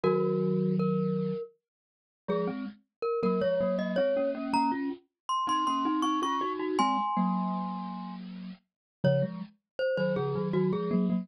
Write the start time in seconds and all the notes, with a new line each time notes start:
0.03 D#3 F#3 F#4 A#4
0.79 A#4
2.28 F3 G#3 G#4
2.47 G#3 C4
3.02 A#4
3.23 F#3 A#3 A#4
3.41 F3 G#3 C#5
3.61 F#3 A#3
3.78 F#3 A#3 D#5
3.96 G#3 C4 C#5
4.17 A#3 C#4
4.35 A#3 C#4
4.53 A#3 C#4 A#5
4.72 C#4 F4
5.29 C6
5.47 C4 D#4 C6
5.67 A#3 C#4 C6
5.85 C4 D#4
6.02 C4 D#4 C#6
6.22 C#4 F4 C#6
6.41 D#4 F#4
6.59 D#4 F#4
6.79 G#3 C4 G#5 C6
7.17 F#3 A#3
9.04 C#3 F3 C#5
9.22 F3 G#3
9.79 C5
9.97 D#3 F#3 C5
10.16 C#3 F3 G#4
10.35 D#3 F#3
10.53 D#3 F#3 F#4
10.72 F3 G#3 G#4
10.91 F#3 A#3
11.10 F#3 A#3